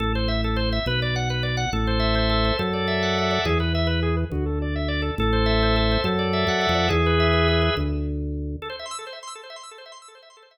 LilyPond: <<
  \new Staff \with { instrumentName = "Drawbar Organ" } { \clef bass \time 6/8 \key a \dorian \tempo 4. = 139 a,,2. | b,,2. | a,,2. | fis,2. |
e,2. | d,2. | a,,2. | fis,4. fis,8. f,8. |
e,2. | d,2. | r2. | r2. |
r2. | }
  \new Staff \with { instrumentName = "Drawbar Organ" } { \time 6/8 \key a \dorian a'8 c''8 e''8 a'8 c''8 e''8 | b'8 d''8 fis''8 b'8 d''8 fis''8 | a'8 c''8 e''8 c''8 a'8 c''8 | a'8 d''8 e''8 fis''8 e''8 d''8 |
gis'8 b'8 e''8 b'8 gis'8 b'8 | fis'8 a'8 d''8 e''8 d''8 a'8 | a'8 c''8 e''8 c''8 a'8 c''8 | a'8 d''8 e''8 fis''8 e''8 d''8 |
gis'8 b'8 e''8 b'8 gis'8 b'8 | r2. | a'16 c''16 e''16 c'''16 e'''16 a'16 c''16 e''16 c'''16 e'''16 a'16 c''16 | e''16 c'''16 e'''16 a'16 c''16 e''16 c'''16 e'''16 a'16 c''16 e''16 c'''16 |
a'16 c''16 e''16 r2 r16 | }
>>